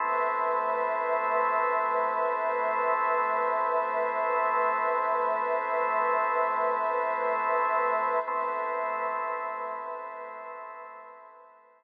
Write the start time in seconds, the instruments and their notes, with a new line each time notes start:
0.00 pad 5 (bowed) A3 B4 C5 E5, drawbar organ A3 B3 C4 E4
8.27 drawbar organ A3 B3 C4 E4, pad 5 (bowed) A3 B4 C5 E5